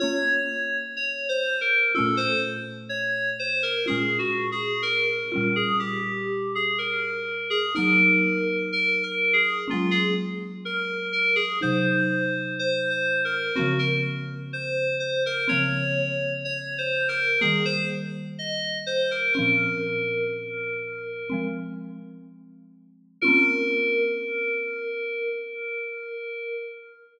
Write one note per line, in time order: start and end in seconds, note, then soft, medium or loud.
0.00 1.90 A#3 medium
0.00 1.90 C#4 medium
0.00 1.90 F4 medium
0.00 0.77 C#5 loud
0.97 1.27 C#5 medium
1.29 1.59 C5 medium
1.61 1.92 A#4 medium
1.95 3.84 A3 medium
1.95 3.84 C#4 medium
1.95 3.84 F4 medium
1.95 2.18 A4 medium
2.00 3.84 A#2 medium
2.17 2.40 C5 loud
2.89 3.30 C#5 medium
3.39 3.62 C5 medium
3.63 3.86 A#4 medium
3.86 5.24 G#3 medium
3.86 5.24 C#4 medium
3.86 5.24 F4 medium
3.86 4.18 G#4 medium
3.92 5.24 A#2 medium
4.19 4.49 F#4 medium
4.52 4.82 G#4 medium
4.82 5.53 A#4 medium
5.32 7.70 G3 medium
5.32 7.70 C#4 medium
5.32 7.70 F4 medium
5.38 7.70 A#2 medium
5.56 5.79 G#4 medium
5.79 6.50 G4 medium
6.55 6.78 G#4 medium
6.78 7.49 A#4 medium
7.50 7.73 G#4 medium
7.75 9.65 F#3 medium
7.75 9.65 A#3 medium
7.75 9.65 D#4 medium
7.75 8.56 A#4 loud
8.73 9.02 A#4 medium
9.03 9.34 A#4 medium
9.33 9.64 G#4 medium
9.68 11.57 G#3 medium
9.68 11.57 A#3 medium
9.68 11.57 C#4 medium
9.68 9.93 F4 medium
9.73 11.57 F#3 medium
9.91 10.14 G#4 medium
10.65 11.07 A#4 medium
11.13 11.36 A#4 medium
11.36 11.59 G#4 medium
11.61 13.51 C3 medium
11.61 13.51 F#3 medium
11.61 13.51 D#4 medium
11.61 12.54 C5 medium
12.59 12.90 C5 medium
12.90 13.21 C5 medium
13.25 13.55 A#4 medium
13.55 15.45 A#3 medium
13.55 15.45 C4 medium
13.55 13.78 F#4 medium
13.59 15.45 C#3 medium
13.59 15.45 F3 medium
13.79 14.02 A#4 medium
14.53 14.96 C5 medium
15.00 15.23 C5 medium
15.26 15.49 A#4 loud
15.48 17.37 F3 medium
15.48 17.37 A#3 medium
15.48 17.37 C4 medium
15.48 16.33 C#5 loud
15.53 17.37 C#3 medium
16.45 16.75 C#5 medium
16.78 17.09 C5 medium
17.08 17.39 A#4 loud
17.41 19.31 G3 medium
17.41 19.31 A#3 medium
17.41 17.64 G#4 medium
17.45 19.31 D#3 medium
17.65 17.88 C5 loud
18.39 18.78 D#5 medium
18.86 19.09 C5 medium
19.11 19.33 A#4 medium
19.33 21.25 C4 medium
19.33 21.25 C#4 medium
19.33 21.44 A#4 medium
19.39 21.25 A#2 medium
19.39 21.25 F3 medium
21.30 23.19 F3 medium
21.30 23.19 G#3 medium
21.30 23.19 C4 medium
23.21 26.72 C#4 loud
23.21 26.72 F4 loud
23.21 26.71 A#4 loud
23.26 26.72 A#3 loud
23.26 26.72 C4 medium